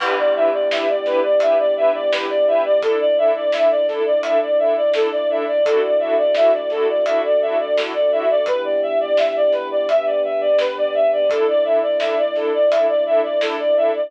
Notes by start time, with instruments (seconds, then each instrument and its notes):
0.00 synth bass 2 E2, choir aahs B3 D4 E4 G4, string ensemble 1 D4 E4 G4 B4, violin B4, kick, crash
0.18 violin D5
0.35 synth bass 2 E2, string ensemble 1 D4 E4 G4 B4, violin E5
0.53 violin D5
0.70 synth bass 2 E2, string ensemble 1 D4 E4 G4 B4, violin E5, snare
0.88 violin D5
1.05 synth bass 2 E2, string ensemble 1 D4 E4 G4 B4, violin B4, snare
1.23 violin D5
1.40 synth bass 2 E2, string ensemble 1 D4 E4 G4 B4, violin E5, closed hi-hat
1.59 violin D5
1.76 synth bass 2 E2, string ensemble 1 D4 E4 G4 B4, violin E5
1.94 violin D5
2.12 synth bass 2 E2, string ensemble 1 D4 E4 G4 B4, violin B4, snare
2.29 violin D5
2.47 synth bass 2 E2, string ensemble 1 D4 E4 G4 B4, violin E5
2.64 violin D5
2.82 choir aahs A3 D4 E4, string ensemble 1 D4 E4 A4, violin A4, kick, closed hi-hat
3.00 violin D5
3.18 string ensemble 1 D4 E4 A4, violin E5
3.35 violin D5
3.52 string ensemble 1 D4 E4 A4, violin E5, snare
3.71 violin D5
3.88 string ensemble 1 D4 E4 A4, violin A4, snare
4.06 violin D5
4.23 string ensemble 1 D4 E4 A4, violin E5, closed hi-hat
4.41 violin D5
4.59 string ensemble 1 D4 E4 A4, violin E5
4.77 violin D5
4.94 string ensemble 1 D4 E4 A4, violin A4, snare
5.11 violin D5
5.29 string ensemble 1 D4 E4 A4, violin E5
5.47 violin D5
5.65 synth bass 2 D2, choir aahs A3 D4 E4 F#4, string ensemble 1 D4 E4 F#4 A4, violin A4, kick, closed hi-hat
5.82 violin D5
6.00 synth bass 2 D2, string ensemble 1 D4 E4 F#4 A4, violin E5
6.17 violin D5
6.35 synth bass 2 D2, string ensemble 1 D4 E4 F#4 A4, violin E5, snare
6.53 violin D5
6.70 synth bass 2 D2, string ensemble 1 D4 E4 F#4 A4, violin A4, snare
6.88 violin D5
7.05 synth bass 2 D2, choir aahs A3 D4 F#4 A4, string ensemble 1 D4 E4 F#4 A4, violin E5, closed hi-hat
7.24 violin D5
7.41 synth bass 2 D2, string ensemble 1 D4 E4 F#4 A4, violin E5
7.59 violin D5
7.76 synth bass 2 D2, string ensemble 1 D4 E4 F#4 A4, violin A4, snare
7.94 violin D5
8.11 synth bass 2 D2, string ensemble 1 D4 E4 F#4 A4, violin E5
8.30 violin D5
8.46 synth bass 2 E2, choir aahs B3 D4 E4 G4, violin B4, kick, closed hi-hat
8.64 violin D5
8.82 synth bass 2 E2, violin E5
9.00 violin D5
9.17 synth bass 2 E2, violin E5, snare
9.36 violin D5
9.52 synth bass 2 E2, violin B4, snare
9.71 violin D5
9.87 synth bass 2 E2, choir aahs B3 D4 G4 B4, violin E5, closed hi-hat
10.06 violin D5
10.23 synth bass 2 E2, violin E5
10.41 violin D5
10.59 synth bass 2 G2, violin B4, snare
10.77 violin D5
10.94 synth bass 2 G#2, violin E5
11.12 violin D5
11.29 synth bass 2 A1, choir aahs A3 D4 E4, string ensemble 1 D4 E4 A4, violin A4, kick, closed hi-hat
11.48 violin D5
11.64 synth bass 2 A1, string ensemble 1 D4 E4 A4, violin E5
11.82 violin D5
12.00 synth bass 2 A1, string ensemble 1 D4 E4 A4, violin E5, snare
12.17 violin D5
12.35 synth bass 2 A1, string ensemble 1 D4 E4 A4, violin A4, snare
12.53 violin D5
12.70 synth bass 2 A1, string ensemble 1 D4 E4 A4, violin E5, closed hi-hat
12.88 violin D5
13.06 synth bass 2 A1, string ensemble 1 D4 E4 A4, violin E5
13.23 violin D5
13.41 synth bass 2 A1, string ensemble 1 D4 E4 A4, violin A4, snare
13.59 violin D5
13.76 synth bass 2 A1, string ensemble 1 D4 E4 A4, violin E5
13.94 violin D5